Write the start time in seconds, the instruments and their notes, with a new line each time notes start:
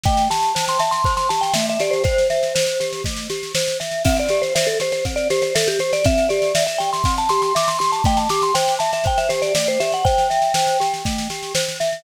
0.04 glockenspiel A3, vibraphone G5, kick, snare
0.17 snare
0.30 glockenspiel G4, vibraphone A5, snare
0.43 snare
0.55 glockenspiel C5, snare
0.68 vibraphone C6, snare
0.79 glockenspiel E5, vibraphone A5, snare
0.91 vibraphone C6, snare
1.04 glockenspiel C5, kick, snare
1.17 vibraphone C6, snare
1.29 glockenspiel G4, vibraphone A5, snare
1.41 vibraphone G5, snare
1.54 glockenspiel A3, vibraphone E5, snare
1.69 vibraphone E5, snare
1.80 glockenspiel G4, vibraphone D5, snare
1.91 vibraphone C5, snare
2.04 vibraphone C5, glockenspiel C5, kick, snare
2.18 snare
2.30 glockenspiel E5, snare
2.43 snare
2.55 glockenspiel C5, snare
2.67 snare
2.80 glockenspiel G4, snare
2.93 snare
3.04 glockenspiel A3, kick, snare
3.17 snare
3.30 glockenspiel G4, snare
3.43 snare
3.55 glockenspiel C5, snare
3.68 snare
3.80 glockenspiel E5, snare
3.91 snare
4.05 glockenspiel C4, vibraphone E5, kick, snare, crash
4.16 vibraphone D5, snare
4.29 glockenspiel G4, snare
4.42 vibraphone C5, snare
4.55 vibraphone C5, glockenspiel E5, snare
4.67 vibraphone A4, snare
4.80 glockenspiel G4, vibraphone C5, snare
4.92 vibraphone C5, snare
5.05 glockenspiel C4, kick, snare
5.16 vibraphone D5, snare
5.30 glockenspiel G4, vibraphone C5, snare
5.42 vibraphone C5, snare
5.55 vibraphone A4, glockenspiel E5, snare
5.68 vibraphone G4, snare
5.79 glockenspiel G4, vibraphone C5, snare
5.93 vibraphone D5, snare
6.04 glockenspiel C4, vibraphone E5, kick, snare
6.18 snare
6.29 glockenspiel G4, vibraphone D5, snare
6.42 snare
6.55 glockenspiel E5, snare
6.67 vibraphone E5, snare
6.78 glockenspiel G4, vibraphone G5, snare
6.93 vibraphone C6, snare
7.04 glockenspiel C4, kick, snare
7.18 vibraphone A5, snare
7.29 glockenspiel G4, vibraphone C6, snare
7.42 vibraphone C6, snare
7.55 glockenspiel E5, vibraphone D6, snare
7.68 vibraphone C6, snare
7.79 glockenspiel G4, vibraphone C6, snare
7.92 vibraphone A5, snare
8.04 glockenspiel A3, vibraphone G5, kick, snare
8.17 vibraphone A5, snare
8.29 glockenspiel G4, vibraphone D6, snare
8.42 vibraphone C6, snare
8.54 glockenspiel C5, vibraphone G5, snare
8.68 snare
8.79 glockenspiel E5, vibraphone A5, snare
8.93 vibraphone E5, snare
9.04 glockenspiel C5, vibraphone G5, kick, snare
9.18 vibraphone E5, snare
9.29 glockenspiel G4, vibraphone C5, snare
9.42 vibraphone D5, snare
9.55 glockenspiel A3, vibraphone D5, snare
9.67 vibraphone C5, snare
9.80 glockenspiel G4, vibraphone E5, snare
9.92 vibraphone F#5, snare
10.05 glockenspiel C5, vibraphone G5, kick, snare
10.18 snare
10.30 glockenspiel E5, snare
10.42 snare
10.54 glockenspiel C5, snare
10.67 snare
10.80 glockenspiel G4, snare
10.94 snare
11.05 glockenspiel A3, kick, snare
11.18 snare
11.30 glockenspiel G4, snare
11.43 snare
11.55 glockenspiel C5, snare
11.68 snare
11.80 glockenspiel E5, snare
11.93 snare